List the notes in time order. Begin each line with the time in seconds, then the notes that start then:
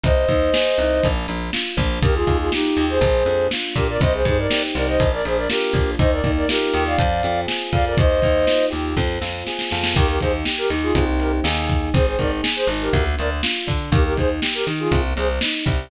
0.04 C2 C4 C5 D#5, kick, closed hi-hat
0.29 D#2 D#4, kick, closed hi-hat
0.53 G#4, snare
0.78 C2 D#4, closed hi-hat
1.03 A#1 A#3, kick, closed hi-hat
1.28 A#1 D4, closed hi-hat
1.53 F4, snare
1.77 A#1 D4, kick, closed hi-hat
2.02 D#2 A#3 G4 A#4, kick, closed hi-hat
2.14 F4 G#4
2.27 D#2 D#4, kick, closed hi-hat
2.40 F4 G#4
2.51 D#4 F4 G4, snare
2.77 D#2 G4, closed hi-hat
2.89 G#4 C5
3.01 A#1 A#3, kick, closed hi-hat
3.26 F2 D4, closed hi-hat
3.51 F4, snare
3.76 A#2 D4 G4 A#4, kick, closed hi-hat
3.89 A#4 D5
4.01 C2 C4 C5 D#5, kick, closed hi-hat
4.13 G#4 C5
4.25 G2 D#4 G#4 C5, kick, closed hi-hat
4.38 A#4 D5
4.51 G4, snare
4.75 C2 D#4 A#4 D5, closed hi-hat
4.88 C5 D#5
5.00 A#1 A#3, kick, closed hi-hat
5.13 A#4 D5
5.25 A#1 D4 G#4 C5, closed hi-hat
5.37 A#4 D5
5.50 F4 G4 A#4, snare
5.73 A#1 D4, kick, closed hi-hat
5.99 D#2 A#3 C5 D#5, kick, closed hi-hat
6.11 A#4 D5
6.24 D#2 D#4, kick, closed hi-hat
6.37 A#4 D5
6.49 F4 G4 A#4, snare
6.74 D#2 G4, closed hi-hat
6.86 D5 F5
6.98 F2 C4, kick, closed hi-hat
7.23 F2 F4, closed hi-hat
7.47 G#4, snare
7.73 F2 F4 D5 F5, kick, closed hi-hat
7.85 A#4 D5
7.97 D#2 A#3 C5 D#5, kick, closed hi-hat
8.22 D#2 D#4, kick, closed hi-hat
8.47 F4, snare
8.70 D#2 G4, closed hi-hat
8.97 F2 C4, kick, snare
9.22 F2 F4, snare
9.47 G#4, snare
9.59 snare
9.71 F2 F4, snare
9.83 snare
9.94 D#2 A#3 G4 A#4, kick, closed hi-hat
10.08 G4 A#4
10.20 D#2 D#4 G#4 C5, kick, closed hi-hat
10.45 G4, snare
10.58 G4 A#4
10.70 D#2 D#4, closed hi-hat
10.82 F4 G#4
10.95 C2 A#3 C4 D#4 G4, kick, closed hi-hat
11.20 G4 A#4, closed hi-hat
11.44 D#2 A#3 D#4 G#4, snare
11.69 kick, closed hi-hat
11.94 G#1 C4 G#4 C5, kick, closed hi-hat
12.07 G#4 C5
12.19 G#1 D#4 A#4 D5, kick, closed hi-hat
12.43 G#4, snare
12.56 G#4 C5
12.67 G#1 D#4, closed hi-hat
12.82 G4 A#4
12.93 D2 A#3, kick, closed hi-hat
13.18 D2 D4 A#4 D5, closed hi-hat
13.43 F4, snare
13.67 D3 D4, kick, closed hi-hat
13.92 D#2 A#3 G4 A#4, kick, closed hi-hat
14.05 G4 A#4
14.16 D#2 D#4 G#4 C5, kick, closed hi-hat
14.42 G4, snare
14.54 G4 A#4
14.67 D#3 D#4, closed hi-hat
14.79 F4 G#4
14.91 C2 A#3, kick, closed hi-hat
15.16 C2 C4 G#4 C5, closed hi-hat
15.41 D#4, snare
15.65 C2 G4, kick, closed hi-hat